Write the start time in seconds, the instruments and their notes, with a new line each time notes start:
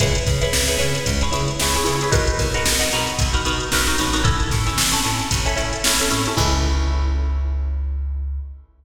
0.00 electric bass (finger) C#2, pizzicato strings E4 G#4 B4 C#5, kick, closed hi-hat
0.15 closed hi-hat
0.27 electric bass (finger) C#3, kick, snare, closed hi-hat
0.41 pizzicato strings E4 G#4 B4 C#5, snare, closed hi-hat
0.53 electric bass (finger) C#2, snare
0.68 pizzicato strings E4 G#4 B4 C#5, closed hi-hat
0.78 electric bass (finger) C#3, pizzicato strings E4 G#4 B4 C#5, closed hi-hat
0.95 closed hi-hat
1.06 electric bass (finger) C#2, kick, closed hi-hat
1.21 pizzicato strings E4 G#4 B4 C#5, closed hi-hat
1.32 electric bass (finger) C#3, pizzicato strings E4 G#4 B4 C#5, closed hi-hat
1.48 closed hi-hat
1.60 electric bass (finger) C#2, pizzicato strings E4 G#4 B4 C#5, snare
1.74 pizzicato strings E4 G#4 B4 C#5, closed hi-hat
1.84 electric bass (finger) C#3, pizzicato strings E4 G#4 B4 C#5, closed hi-hat
2.01 pizzicato strings E4 G#4 B4 C#5, closed hi-hat
2.11 electric bass (finger) B1, pizzicato strings D#4 F#4 A#4 B4, kick, closed hi-hat
2.27 closed hi-hat
2.39 electric bass (finger) B2, kick, snare, closed hi-hat
2.54 pizzicato strings D#4 F#4 A#4 B4, closed hi-hat
2.65 electric bass (finger) B1, snare
2.79 pizzicato strings D#4 F#4 A#4 B4, closed hi-hat
2.92 electric bass (finger) B2, pizzicato strings D#4 F#4 A#4 B4, closed hi-hat
3.07 closed hi-hat
3.19 electric bass (finger) B1, kick, closed hi-hat
3.33 pizzicato strings D#4 F#4 A#4 B4, closed hi-hat
3.45 electric bass (finger) B2, pizzicato strings D#4 F#4 A#4 B4, closed hi-hat
3.60 closed hi-hat
3.72 electric bass (finger) B1, pizzicato strings D#4 F#4 A#4 B4, snare
3.87 pizzicato strings D#4 F#4 A#4 B4, closed hi-hat
3.98 electric bass (finger) A1, pizzicato strings D#4 F#4 A#4 B4, closed hi-hat
4.13 pizzicato strings D#4 F#4 A#4 B4, snare, closed hi-hat
4.24 pizzicato strings C#4 E4 A4, kick, closed hi-hat
4.40 closed hi-hat
4.51 electric bass (finger) A2, kick, snare, closed hi-hat
4.66 pizzicato strings C#4 E4 A4, closed hi-hat
4.78 electric bass (finger) A1, snare
4.92 pizzicato strings C#4 E4 A4, snare, closed hi-hat
5.04 electric bass (finger) A2, pizzicato strings C#4 E4 A4, closed hi-hat
5.19 closed hi-hat
5.31 electric bass (finger) A1, kick, closed hi-hat
5.45 pizzicato strings C#4 E4 A4, closed hi-hat
5.56 electric bass (finger) A2, pizzicato strings C#4 E4 A4, closed hi-hat
5.73 closed hi-hat
5.84 electric bass (finger) A1, pizzicato strings C#4 E4 A4, snare
5.99 pizzicato strings C#4 E4 A4, closed hi-hat
6.11 electric bass (finger) A2, pizzicato strings C#4 E4 A4, closed hi-hat
6.26 pizzicato strings C#4 E4 A4, closed hi-hat
6.37 electric bass (finger) C#2, pizzicato strings E4 G#4 B4 C#5, kick, crash